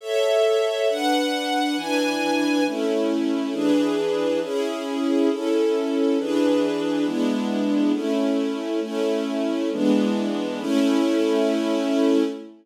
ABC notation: X:1
M:6/8
L:1/8
Q:3/8=68
K:A
V:1 name="String Ensemble 1"
[Ace]3 [DBf]3 | [E,DBg]3 [A,CE]3 | [E,DGB]3 [CEG]3 | [CEA]3 [E,DGB]3 |
[G,B,DE]3 [A,CE]3 | [A,CE]3 [E,G,B,D]3 | [A,CE]6 |]